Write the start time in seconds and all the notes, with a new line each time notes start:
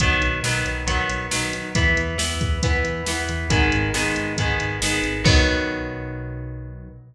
0.00 B1 D#3 F#3 B3, kick, closed hi-hat
0.21 B1, closed hi-hat
0.43 B1 D#3 F#3 B3, snare
0.65 B1, closed hi-hat
0.87 B1 D#3 F#3 B3, kick, closed hi-hat
1.09 B1, closed hi-hat
1.31 B1 D#3 F#3 B3, snare
1.53 B1, closed hi-hat
1.75 E2 E3 B3, kick, closed hi-hat
1.97 E2, closed hi-hat
2.18 E2 E3 B3, snare
2.41 E2, kick, closed hi-hat
2.63 E2 E3 B3, kick, closed hi-hat
2.84 E2, closed hi-hat
3.06 E2 E3 B3, snare
3.29 E2, closed hi-hat
3.50 G#1 D#3 G#3 B3, kick, closed hi-hat
3.72 G#1, closed hi-hat
3.94 G#1 D#3 G#3 B3, snare
4.16 G#1, closed hi-hat
4.36 G#1 D#3 G#3 B3, kick, closed hi-hat
4.60 G#1, closed hi-hat
4.81 G#1 D#3 G#3 B3, snare
5.03 G#1, closed hi-hat
5.24 B1 D#3 F#3 B3, kick, crash